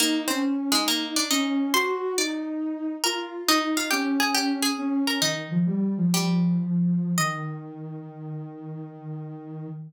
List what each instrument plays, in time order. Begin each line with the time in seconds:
0.00 harpsichord A#3 A#4, ocarina D#4
0.28 harpsichord C4 C5, ocarina C#4
0.72 harpsichord G#3 G#4, ocarina D#4
0.88 harpsichord A#3 A#4
1.16 harpsichord D4 D5
1.30 ocarina C#4, harpsichord D#4 D#5
1.74 ocarina F#4, harpsichord C5 C6
2.17 ocarina D#4, harpsichord D5 D6
3.04 ocarina F4, harpsichord A#4 A#5
3.48 ocarina D#4, harpsichord D#4 D#5
3.77 harpsichord F4 F5
3.91 ocarina C#4, harpsichord G4 G5
4.20 harpsichord G#4 G#5
4.35 harpsichord G4 G5
4.63 harpsichord G#4 G#5
4.78 ocarina C#4
5.07 harpsichord A#4 A#5
5.21 ocarina D#3, harpsichord D#4 D#5
5.51 ocarina F3
5.66 ocarina G3
5.97 ocarina F3
6.14 harpsichord G3 G4
7.18 ocarina D#3, harpsichord D#5